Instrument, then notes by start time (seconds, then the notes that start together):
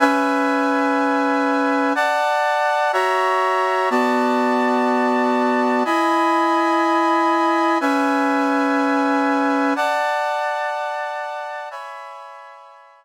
brass section
0.00 C#4 B4 E5 G#5
1.95 D5 F#5 A5
2.93 F#4 C#5 E5 A#5
3.90 B3 F#4 D5 A5
5.85 E4 D#5 G#5 B5
7.81 C#4 B4 E5 G#5
9.76 D5 F#5 A5
11.71 C#5 E5 G#5 B5